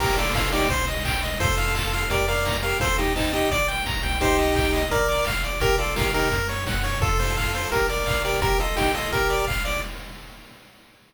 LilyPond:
<<
  \new Staff \with { instrumentName = "Lead 1 (square)" } { \time 4/4 \key bes \major \tempo 4 = 171 <g' bes'>8 <f' a'>8 <f' a'>8 <ees' g'>8 r2 | <f' a'>2 <g' bes'>8 <bes' d''>4 <g' bes'>8 | <f' a'>8 <ees' g'>8 <c' ees'>8 <ees' g'>8 r2 | <ees' g'>2 <bes' d''>4 r4 |
<g' bes'>8 <f' a'>8 <g' bes'>8 <ees' g'>8 r2 | <f' a'>2 <g' bes'>8 <bes' d''>4 <g' bes'>8 | <g' bes'>8 <f' a'>8 <ees' g'>8 <f' a'>8 <g' bes'>4 r4 | }
  \new Staff \with { instrumentName = "Lead 1 (square)" } { \time 4/4 \key bes \major bes'8 d''8 f''8 d''8 c''8 ees''8 g''8 ees''8 | c''8 f''8 a''8 f''8 d''8 f''8 bes''8 f''8 | c''8 ees''8 a''8 ees''8 d''8 g''8 bes''8 g''8 | c''8 ees''8 g''8 ees''8 bes'8 d''8 f''8 d''8 |
bes'8 d''8 f''8 bes'4 des''8 ges''8 des''8 | a'8 c''8 f''8 c''8 bes'8 d''8 f''8 d''8 | bes'8 ees''8 g''8 ees''8 bes'8 d''8 f''8 d''8 | }
  \new Staff \with { instrumentName = "Synth Bass 1" } { \clef bass \time 4/4 \key bes \major bes,,2 c,2 | f,2 f,2 | ees,2 bes,,4. c,8~ | c,2 bes,,4 aes,,8 a,,8 |
bes,,2 ges,2 | f,2 bes,,2 | bes,,2 bes,,2 | }
  \new DrumStaff \with { instrumentName = "Drums" } \drummode { \time 4/4 <cymc bd>8 hho8 <bd sn>8 hho8 <hh bd>8 hho8 <hc bd>8 hho8 | <hh bd>8 hho8 <hc bd>8 hho8 <hh bd>8 hho8 <bd sn>8 hho8 | <hh bd>8 hho8 <hc bd>8 hho8 <hh bd>8 hho8 <bd sn>8 hho8 | <hh bd>8 hho8 <hc bd>8 hho8 <hh bd>8 hho8 <hc bd>8 hho8 |
<hh bd>8 hho8 <bd sn>8 hho8 <hh bd>8 hho8 <bd sn>8 hho8 | <hh bd>8 hho8 <hc bd>8 hho8 <hh bd>8 hho8 <hc bd>8 hho8 | <hh bd>8 hho8 <bd sn>8 hho8 <hh bd>8 hho8 <hc bd>8 hho8 | }
>>